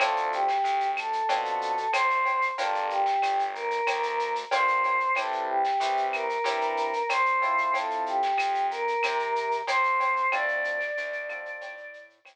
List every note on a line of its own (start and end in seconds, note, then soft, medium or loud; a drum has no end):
0.00 0.58 D2 loud
0.00 0.45 C4 loud
0.00 0.45 D4 loud
0.00 0.45 F4 loud
0.00 0.31 A4 medium
0.00 0.45 A4 loud
0.00 cowbell medium
0.00 claves medium
0.00 shaker medium
0.16 shaker medium
0.32 0.88 G4 medium
0.32 shaker medium
0.48 snare medium
0.48 shaker medium
0.64 1.22 D2 medium
0.64 shaker medium
0.80 shaker medium
0.97 1.91 A4 medium
0.97 claves medium
0.97 shaker medium
1.13 shaker medium
1.29 1.87 B2 medium
1.29 1.74 C4 medium
1.29 1.74 D4 medium
1.29 1.74 F4 medium
1.29 1.74 A4 medium
1.29 cowbell medium
1.29 shaker medium
1.45 shaker medium
1.61 shaker medium
1.77 shaker medium
1.92 2.51 D2 medium
1.92 2.45 C5 medium
1.92 cowbell medium
1.92 claves medium
1.92 shaker loud
2.10 shaker medium
2.25 cowbell medium
2.25 shaker medium
2.42 shaker medium
2.58 3.16 G1 loud
2.58 3.03 D4 loud
2.58 3.03 F4 loud
2.58 3.03 G4 loud
2.58 2.87 A4 medium
2.58 3.03 A#4 loud
2.58 cowbell medium
2.58 shaker loud
2.75 shaker medium
2.90 3.42 G4 medium
2.90 shaker medium
3.06 snare medium
3.06 shaker medium
3.22 3.80 G1 medium
3.22 claves medium
3.22 shaker medium
3.39 shaker medium
3.54 4.31 A#4 medium
3.54 shaker medium
3.71 shaker medium
3.87 4.45 D2 medium
3.87 cowbell medium
3.87 claves medium
3.87 shaker medium
4.03 shaker medium
4.19 shaker medium
4.35 shaker medium
4.51 5.10 G1 medium
4.51 4.97 D4 medium
4.51 4.97 F4 medium
4.51 4.97 G4 medium
4.51 4.97 A#4 medium
4.51 5.11 C5 medium
4.51 cowbell medium
4.51 shaker medium
4.68 shaker medium
4.84 cowbell medium
4.84 shaker medium
5.00 shaker medium
5.15 5.73 C2 loud
5.15 5.61 C4 loud
5.15 5.61 E4 loud
5.15 5.61 G4 loud
5.15 5.44 A4 medium
5.15 5.61 B4 medium
5.15 cowbell medium
5.15 claves medium
5.15 shaker medium
5.32 shaker medium
5.49 6.05 G4 medium
5.64 snare soft
5.64 shaker medium
5.80 6.38 C2 medium
5.80 6.26 C4 medium
5.80 6.26 E4 medium
5.80 6.26 G4 medium
5.80 6.26 B4 medium
5.80 shaker loud
5.97 shaker medium
6.12 7.05 A#4 medium
6.12 claves medium
6.12 shaker medium
6.29 shaker medium
6.44 7.02 G2 medium
6.44 6.90 C4 medium
6.44 6.90 E4 medium
6.44 6.90 G4 loud
6.44 6.90 B4 medium
6.44 cowbell medium
6.44 shaker medium
6.61 shaker medium
6.77 shaker medium
6.93 shaker medium
7.09 7.67 C2 medium
7.09 7.72 C5 medium
7.09 cowbell medium
7.09 claves medium
7.09 shaker medium
7.26 shaker medium
7.42 8.19 C4 loud
7.42 8.19 E4 loud
7.42 8.19 F4 loud
7.42 8.19 A4 loud
7.42 cowbell medium
7.42 shaker medium
7.58 shaker medium
7.74 8.33 F2 loud
7.74 8.03 A4 medium
7.74 cowbell medium
7.74 shaker medium
7.90 shaker medium
8.06 8.66 G4 medium
8.06 shaker medium
8.22 snare soft
8.22 shaker medium
8.37 8.96 F2 medium
8.37 claves medium
8.37 shaker medium
8.55 shaker medium
8.71 9.54 A#4 medium
8.71 shaker medium
8.88 shaker medium
9.03 9.62 C3 loud
9.03 cowbell medium
9.03 claves medium
9.03 shaker medium
9.19 shaker medium
9.36 shaker medium
9.51 shaker medium
9.67 10.26 F2 medium
9.67 10.28 C5 medium
9.67 cowbell medium
9.67 shaker medium
9.84 shaker medium
10.00 cowbell medium
10.00 shaker medium
10.16 shaker medium
10.32 10.91 D2 loud
10.32 10.78 C4 loud
10.32 10.78 D4 loud
10.32 10.78 F4 loud
10.32 10.78 A4 loud
10.32 11.98 D5 medium
10.32 cowbell medium
10.32 claves loud
10.32 shaker medium
10.48 shaker medium
10.64 shaker medium
10.81 snare soft
10.81 shaker medium
10.97 11.56 D2 medium
10.97 shaker medium
11.12 shaker medium
11.29 11.74 C4 loud
11.29 11.74 D4 medium
11.29 11.74 F4 medium
11.29 11.74 A4 loud
11.29 claves medium
11.29 shaker medium
11.45 shaker medium
11.61 12.19 A2 loud
11.61 cowbell medium
11.61 shaker medium
11.77 shaker medium
11.94 shaker medium
12.10 shaker medium
12.25 12.36 D2 medium
12.25 cowbell medium
12.25 claves medium
12.25 shaker loud